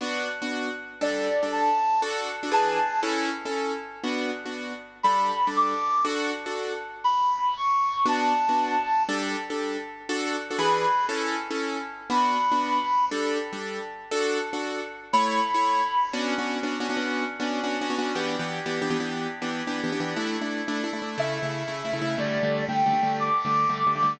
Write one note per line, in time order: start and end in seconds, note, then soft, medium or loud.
0.01 0.28 B3 medium
0.01 0.28 D4 medium
0.01 0.28 F#4 medium
0.42 0.69 B3 medium
0.42 0.69 D4 medium
0.42 0.69 F#4 medium
1.01 1.28 G3 medium
1.01 1.28 D4 medium
1.01 1.28 A4 medium
1.01 1.49 D5 medium
1.43 1.69 G3 medium
1.43 1.69 D4 medium
1.43 1.69 A4 medium
1.52 2.02 A5 medium
2.02 2.29 D4 medium
2.02 2.29 F#4 medium
2.02 2.29 A4 medium
2.43 2.50 D4 medium
2.43 2.50 F#4 medium
2.43 2.50 A4 medium
2.52 2.78 E3 medium
2.52 2.78 D4 medium
2.52 2.78 G#4 medium
2.52 2.78 B4 medium
2.52 3.00 A5 medium
3.03 3.30 C#4 medium
3.03 3.30 E4 medium
3.03 3.30 A4 medium
3.45 3.72 C#4 medium
3.45 3.72 E4 medium
3.45 3.72 A4 medium
4.04 4.30 B3 medium
4.04 4.30 D4 medium
4.04 4.30 F#4 medium
4.46 4.72 B3 medium
4.46 4.72 D4 medium
4.46 4.72 F#4 medium
5.03 5.31 G3 medium
5.03 5.31 D4 medium
5.03 5.31 A4 medium
5.03 5.51 B5 medium
5.47 5.74 G3 medium
5.47 5.74 D4 medium
5.47 5.74 A4 medium
5.56 6.06 D6 medium
6.05 6.32 D4 medium
6.05 6.32 F#4 medium
6.05 6.32 A4 medium
6.46 6.73 D4 medium
6.46 6.73 F#4 medium
6.46 6.73 A4 medium
7.04 7.54 B5 medium
7.57 8.07 C#6 medium
8.06 8.32 B3 medium
8.06 8.32 D4 medium
8.06 8.32 F#4 medium
8.06 9.03 A5 medium
8.49 8.76 B3 medium
8.49 8.76 D4 medium
8.49 8.76 F#4 medium
9.09 9.36 G3 medium
9.09 9.36 D4 medium
9.09 9.36 A4 medium
9.50 9.77 G3 medium
9.50 9.77 D4 medium
9.50 9.77 A4 medium
10.09 10.36 D4 medium
10.09 10.36 F#4 medium
10.09 10.36 A4 medium
10.50 10.57 D4 medium
10.50 10.57 F#4 medium
10.50 10.57 A4 medium
10.59 10.86 E3 medium
10.59 10.86 D4 medium
10.59 10.86 G#4 medium
10.59 10.86 B4 medium
10.59 11.06 B5 medium
11.09 11.36 C#4 medium
11.09 11.36 E4 medium
11.09 11.36 A4 medium
11.51 11.77 C#4 medium
11.51 11.77 E4 medium
11.51 11.77 A4 medium
12.10 12.37 B3 medium
12.10 12.37 D4 medium
12.10 12.37 F#4 medium
12.10 13.05 B5 medium
12.52 12.78 B3 medium
12.52 12.78 D4 medium
12.52 12.78 F#4 medium
13.11 13.38 G3 medium
13.11 13.38 D4 medium
13.11 13.38 A4 medium
13.53 13.79 G3 medium
13.53 13.79 D4 medium
13.53 13.79 A4 medium
14.11 14.38 D4 medium
14.11 14.38 F#4 medium
14.11 14.38 A4 medium
14.53 14.80 D4 medium
14.53 14.80 F#4 medium
14.53 14.80 A4 medium
15.13 15.40 A3 medium
15.13 15.40 E4 medium
15.13 15.40 C#5 medium
15.13 16.09 B5 medium
15.54 15.81 A3 medium
15.54 15.81 E4 medium
15.54 15.81 C#5 medium
16.13 16.33 B3 medium
16.13 16.33 C#4 medium
16.13 16.33 D4 medium
16.13 16.33 F#4 medium
16.38 16.58 B3 medium
16.38 16.58 C#4 medium
16.38 16.58 D4 medium
16.38 16.58 F#4 medium
16.63 16.77 B3 medium
16.63 16.77 C#4 medium
16.63 16.77 D4 medium
16.63 16.77 F#4 medium
16.80 16.87 B3 medium
16.80 16.87 C#4 medium
16.80 16.87 D4 medium
16.80 16.87 F#4 medium
16.89 16.96 B3 medium
16.89 16.96 C#4 medium
16.89 16.96 D4 medium
16.89 16.96 F#4 medium
16.97 17.24 B3 medium
16.97 17.24 C#4 medium
16.97 17.24 D4 medium
16.97 17.24 F#4 medium
17.40 17.60 B3 medium
17.40 17.60 C#4 medium
17.40 17.60 D4 medium
17.40 17.60 F#4 medium
17.64 17.77 B3 medium
17.64 17.77 C#4 medium
17.64 17.77 D4 medium
17.64 17.77 F#4 medium
17.81 17.88 B3 medium
17.81 17.88 C#4 medium
17.81 17.88 D4 medium
17.81 17.88 F#4 medium
17.90 17.97 B3 medium
17.90 17.97 C#4 medium
17.90 17.97 D4 medium
17.90 17.97 F#4 medium
17.99 18.12 B3 medium
17.99 18.12 C#4 medium
17.99 18.12 D4 medium
17.99 18.12 F#4 medium
18.15 18.35 E3 medium
18.15 18.35 B3 medium
18.15 18.35 D4 medium
18.15 18.35 G4 medium
18.39 18.59 E3 medium
18.39 18.59 B3 medium
18.39 18.59 D4 medium
18.39 18.59 G4 medium
18.66 18.79 E3 medium
18.66 18.79 B3 medium
18.66 18.79 D4 medium
18.66 18.79 G4 medium
18.82 18.88 E3 medium
18.82 18.88 B3 medium
18.82 18.88 D4 medium
18.82 18.88 G4 medium
18.90 18.97 E3 medium
18.90 18.97 B3 medium
18.90 18.97 D4 medium
18.90 18.97 G4 medium
19.00 19.27 E3 medium
19.00 19.27 B3 medium
19.00 19.27 D4 medium
19.00 19.27 G4 medium
19.42 19.62 E3 medium
19.42 19.62 B3 medium
19.42 19.62 D4 medium
19.42 19.62 G4 medium
19.67 19.81 E3 medium
19.67 19.81 B3 medium
19.67 19.81 D4 medium
19.67 19.81 G4 medium
19.84 19.90 E3 medium
19.84 19.90 B3 medium
19.84 19.90 D4 medium
19.84 19.90 G4 medium
19.92 19.99 E3 medium
19.92 19.99 B3 medium
19.92 19.99 D4 medium
19.92 19.99 G4 medium
20.00 20.14 E3 medium
20.00 20.14 B3 medium
20.00 20.14 D4 medium
20.00 20.14 G4 medium
20.16 20.36 A3 medium
20.16 20.36 D4 medium
20.16 20.36 E4 medium
20.41 20.62 A3 medium
20.41 20.62 D4 medium
20.41 20.62 E4 medium
20.68 20.82 A3 medium
20.68 20.82 D4 medium
20.68 20.82 E4 medium
20.84 20.90 A3 medium
20.84 20.90 D4 medium
20.84 20.90 E4 medium
20.93 21.00 A3 medium
20.93 21.00 D4 medium
20.93 21.00 E4 medium
21.02 21.15 A3 medium
21.02 21.15 D4 medium
21.02 21.15 E4 medium
21.18 21.38 C#3 medium
21.18 21.38 A3 medium
21.18 21.38 E4 medium
21.18 22.16 E5 medium
21.42 21.63 C#3 medium
21.42 21.63 A3 medium
21.42 21.63 E4 medium
21.68 21.81 C#3 medium
21.68 21.81 A3 medium
21.68 21.81 E4 medium
21.85 21.91 C#3 medium
21.85 21.91 A3 medium
21.85 21.91 E4 medium
21.93 22.00 C#3 medium
21.93 22.00 A3 medium
21.93 22.00 E4 medium
22.01 22.15 C#3 medium
22.01 22.15 A3 medium
22.01 22.15 E4 medium
22.18 22.38 D3 medium
22.18 22.38 G3 medium
22.18 22.38 A3 medium
22.18 22.65 D5 medium
22.43 22.63 D3 medium
22.43 22.63 G3 medium
22.43 22.63 A3 medium
22.68 22.82 D3 medium
22.68 22.82 G3 medium
22.68 22.82 A3 medium
22.68 23.18 G5 medium
22.86 22.93 D3 medium
22.86 22.93 G3 medium
22.86 22.93 A3 medium
22.93 23.00 D3 medium
22.93 23.00 G3 medium
22.93 23.00 A3 medium
23.03 23.29 D3 medium
23.03 23.29 G3 medium
23.03 23.29 A3 medium
23.20 24.12 D6 medium
23.45 23.65 D3 medium
23.45 23.65 G3 medium
23.45 23.65 A3 medium
23.69 23.83 D3 medium
23.69 23.83 G3 medium
23.69 23.83 A3 medium
23.87 23.93 D3 medium
23.87 23.93 G3 medium
23.87 23.93 A3 medium
23.95 24.02 D3 medium
23.95 24.02 G3 medium
23.95 24.02 A3 medium
24.03 24.16 D3 medium
24.03 24.16 G3 medium
24.03 24.16 A3 medium